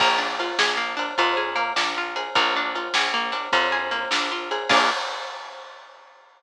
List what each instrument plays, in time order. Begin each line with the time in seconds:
0.00 electric bass (finger) A#1, acoustic guitar (steel) A#3, kick, crash
0.18 acoustic guitar (steel) D4
0.39 acoustic guitar (steel) F4, ride
0.59 electric bass (finger) A#1, acoustic guitar (steel) G#4, snare
0.77 acoustic guitar (steel) A#3
0.97 acoustic guitar (steel) D4, ride
1.18 electric bass (finger) F2, acoustic guitar (steel) F4, kick, ride
1.37 acoustic guitar (steel) G#4
1.56 acoustic guitar (steel) A#3, ride
1.76 electric bass (finger) A#1, acoustic guitar (steel) D4, snare
1.98 acoustic guitar (steel) F4
2.16 acoustic guitar (steel) G#4, ride
2.35 electric bass (finger) A#1, acoustic guitar (steel) A#3, kick, ride
2.56 acoustic guitar (steel) D4
2.75 acoustic guitar (steel) F4, ride
2.94 electric bass (finger) A#1, acoustic guitar (steel) G#4, snare
3.14 acoustic guitar (steel) A#3
3.32 acoustic guitar (steel) D4, ride
3.52 electric bass (finger) F2, acoustic guitar (steel) F4, kick, ride
3.72 acoustic guitar (steel) G#4
3.91 acoustic guitar (steel) A#3, ride
4.11 electric bass (finger) A#1, acoustic guitar (steel) D4, snare
4.32 acoustic guitar (steel) F4
4.51 acoustic guitar (steel) G#4, ride
4.69 electric bass (finger) A#1, acoustic guitar (steel) A#3 D4 F4 G#4, kick, crash